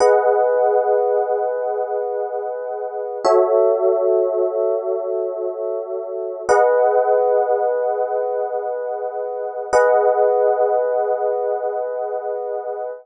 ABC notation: X:1
M:4/4
L:1/8
Q:1/4=74
K:G#phr
V:1 name="Electric Piano 1"
[GBdf]8 | [FAce]8 | [GBdf]8 | [GBdf]8 |]